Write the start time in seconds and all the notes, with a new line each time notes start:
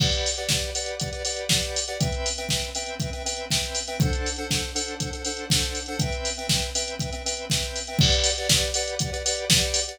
0.00 G4 B4 D5 F#5, kick, crash
0.12 closed hi-hat
0.26 open hi-hat
0.38 G4 B4 D5 F#5, closed hi-hat
0.49 G4 B4 D5 F#5, kick, snare
0.62 closed hi-hat
0.75 G4 B4 D5 F#5, open hi-hat
0.86 closed hi-hat
1.00 G4 B4 D5 F#5, kick, closed hi-hat
1.13 G4 B4 D5 F#5, closed hi-hat
1.25 G4 B4 D5 F#5, open hi-hat
1.37 closed hi-hat
1.49 G4 B4 D5 F#5, kick, snare
1.63 closed hi-hat
1.76 open hi-hat
1.88 G4 B4 D5 F#5, closed hi-hat
2.00 C4 B4 E5 G5, kick, closed hi-hat
2.12 closed hi-hat
2.26 open hi-hat
2.38 C4 B4 E5 G5, closed hi-hat
2.49 C4 B4 E5 G5, kick, snare
2.62 closed hi-hat
2.75 C4 B4 E5 G5, open hi-hat
2.86 closed hi-hat
3.00 C4 B4 E5 G5, kick, closed hi-hat
3.13 C4 B4 E5 G5, closed hi-hat
3.25 C4 B4 E5 G5, open hi-hat
3.37 closed hi-hat
3.50 C4 B4 E5 G5, kick, snare
3.63 closed hi-hat
3.75 open hi-hat
3.88 C4 B4 E5 G5, closed hi-hat
4.00 D4 A4 C5 F#5, kick, closed hi-hat
4.13 closed hi-hat
4.26 open hi-hat
4.36 D4 A4 C5 F#5, closed hi-hat
4.50 D4 A4 C5 F#5, kick, snare
4.63 closed hi-hat
4.75 D4 A4 C5 F#5, open hi-hat
4.88 closed hi-hat
5.00 D4 A4 C5 F#5, kick, closed hi-hat
5.12 D4 A4 C5 F#5, closed hi-hat
5.25 D4 A4 C5 F#5, open hi-hat
5.37 closed hi-hat
5.50 D4 A4 C5 F#5, kick, snare
5.63 closed hi-hat
5.75 open hi-hat
5.86 D4 A4 C5 F#5, closed hi-hat
5.99 C4 B4 E5 G5, kick, closed hi-hat
6.12 closed hi-hat
6.25 open hi-hat
6.37 C4 B4 E5 G5, closed hi-hat
6.49 C4 B4 E5 G5, kick, snare
6.62 closed hi-hat
6.75 C4 B4 E5 G5, open hi-hat
6.88 closed hi-hat
6.99 C4 B4 E5 G5, kick, closed hi-hat
7.12 C4 B4 E5 G5, closed hi-hat
7.25 C4 B4 E5 G5, open hi-hat
7.37 closed hi-hat
7.50 C4 B4 E5 G5, kick, snare
7.63 closed hi-hat
7.76 open hi-hat
7.87 C4 B4 E5 G5, closed hi-hat
7.99 G4 B4 D5 F#5, kick, crash
8.12 closed hi-hat
8.24 open hi-hat
8.38 G4 B4 D5 F#5, closed hi-hat
8.49 G4 B4 D5 F#5, kick, snare
8.62 closed hi-hat
8.74 G4 B4 D5 F#5, open hi-hat
8.88 closed hi-hat
8.99 G4 B4 D5 F#5, kick, closed hi-hat
9.13 G4 B4 D5 F#5, closed hi-hat
9.25 G4 B4 D5 F#5, open hi-hat
9.37 closed hi-hat
9.50 G4 B4 D5 F#5, kick, snare
9.61 closed hi-hat
9.74 open hi-hat
9.87 G4 B4 D5 F#5, closed hi-hat